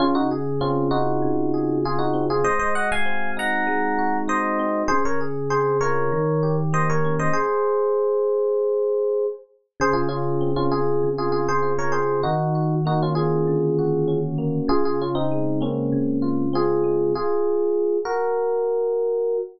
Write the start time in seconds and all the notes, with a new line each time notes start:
0.00 C#3 C#4 F4
0.15 D#4 F#4
0.31 G#4
0.61 C4 C#4 F4
0.91 D#4 F4 F#4
1.22 C#3
1.54 G#4
1.85 F4 G#4
1.99 D#4 F#4
2.14 C4
2.30 F4 G#4
2.44 G#3 C5 D#5
2.59 C5 D#5
2.75 F#4 D#5 F#5
2.92 F5 G#5
3.05 C4
3.37 D#4 F#5 A#5
3.67 G#3
3.99 F#4
4.28 D#4 C5 D#5
4.59 C4
4.88 C#3 G#4 C5
5.05 A#4 C#5
5.21 G#4
5.50 C4 G#4 C5
5.81 F4 A#4 C#5
6.12 D#3
6.43 G4
6.73 A#3 C5 D#5
6.90 A#4 C#5
7.05 C#4
7.19 C5 D#5
7.33 G#4 C5
9.80 C#3 G#4 C5
9.93 F4 G#4
10.09 C#4 F4 G#4
10.41 C4
10.56 C#4 F4
10.71 F4 G#4
11.03 C#3
11.18 F4 G#4
11.32 F4 G#4
11.48 G#4 C5
11.63 F4
11.79 A#4 C#5
11.92 C4 G#4 C5
12.23 D#3 D#4 F#4
12.55 F#4
12.85 A#3 D#4 F#4
13.03 C#4 F4
13.15 C#4 F4 G#4
13.47 D3
13.79 F#4
14.08 C#4
14.38 A#3
14.68 C#3 F4 G#4
14.85 F4 G#4
15.02 C#4 F4
15.15 C4 D#4
15.32 G#3
15.61 A#3 C4 C#4
15.92 C#3
16.22 F4
16.53 C4 F4 G#4
16.84 G#3
17.15 F4 G#4
18.05 F#4 A#4